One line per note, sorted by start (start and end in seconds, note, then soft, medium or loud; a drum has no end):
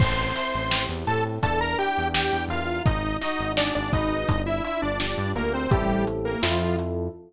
0.00 0.32 A1 medium
0.00 1.37 C4 loud
0.00 0.86 C5 medium
0.00 0.86 C6 loud
0.00 kick medium
0.00 crash medium
0.35 1.37 E4 medium
0.35 snare soft
0.35 closed hi-hat medium
0.55 0.87 A1 medium
0.70 1.38 G4 medium
0.70 snare loud
0.89 1.05 E2 medium
1.07 1.39 A2 medium
1.07 1.24 A4 medium
1.07 1.42 A4 medium
1.07 1.24 A5 medium
1.07 closed hi-hat medium
1.43 1.75 E2 medium
1.43 2.78 D4 loud
1.43 1.60 A4 medium
1.43 1.60 A5 medium
1.43 kick medium
1.43 closed hi-hat medium
1.61 1.78 A#4 medium
1.61 1.78 A#5 loud
1.78 2.80 E4 medium
1.78 2.08 G4 medium
1.78 2.08 G5 loud
1.78 closed hi-hat medium
1.98 2.30 E2 medium
2.13 2.81 G4 medium
2.13 2.45 G4 medium
2.13 2.45 G5 medium
2.13 snare medium
2.33 2.48 E2 medium
2.48 2.81 E2 medium
2.48 2.83 F4 medium
2.48 2.86 A#4 medium
2.48 2.83 F5 medium
2.48 closed hi-hat medium
2.86 3.18 G#1 medium
2.86 4.21 D#4 medium
2.86 3.17 D#4 medium
2.86 3.17 D#5 loud
2.86 kick medium
2.86 closed hi-hat medium
3.21 3.53 D#4 medium
3.21 4.24 F#4 medium
3.21 3.53 D#5 loud
3.21 snare medium
3.21 closed hi-hat medium
3.39 3.71 G#1 medium
3.57 3.74 D4 medium
3.57 4.25 G#4 medium
3.57 3.74 D5 loud
3.57 snare medium
3.75 3.92 G#1 medium
3.75 3.92 D4 medium
3.75 3.92 D5 loud
3.93 4.25 G#1 medium
3.93 4.42 D#4 medium
3.93 4.28 B4 medium
3.93 4.42 D#5 loud
3.93 kick medium
3.93 closed hi-hat medium
4.28 4.61 G1 medium
4.28 5.65 D4 medium
4.28 kick medium
4.28 closed hi-hat medium
4.46 4.63 E4 medium
4.46 4.63 E5 medium
4.64 4.81 E4 medium
4.64 5.66 F4 medium
4.64 4.81 E5 loud
4.64 closed hi-hat medium
4.82 5.14 G1 medium
4.82 4.99 D4 medium
4.82 4.99 D5 medium
5.00 5.32 D4 medium
5.00 5.68 G4 medium
5.00 5.32 D5 medium
5.00 snare medium
5.18 5.34 G2 medium
5.35 5.68 D2 medium
5.35 5.53 A#3 medium
5.35 5.69 A#4 medium
5.35 5.53 A#4 medium
5.35 closed hi-hat medium
5.54 5.71 C4 medium
5.54 5.71 C5 medium
5.70 6.36 A1 medium
5.70 6.05 G3 medium
5.70 6.35 C4 loud
5.70 6.35 E4 loud
5.70 6.35 G4 medium
5.70 6.05 G4 loud
5.70 6.35 A4 medium
5.70 kick medium
5.70 closed hi-hat medium
6.07 closed hi-hat medium
6.25 6.42 A#3 medium
6.25 6.42 A#4 medium
6.42 7.09 F2 medium
6.42 6.76 F3 medium
6.42 7.07 C4 medium
6.42 7.07 E4 loud
6.42 7.07 F4 loud
6.42 6.76 F4 medium
6.42 7.07 A4 medium
6.42 snare medium
6.79 closed hi-hat medium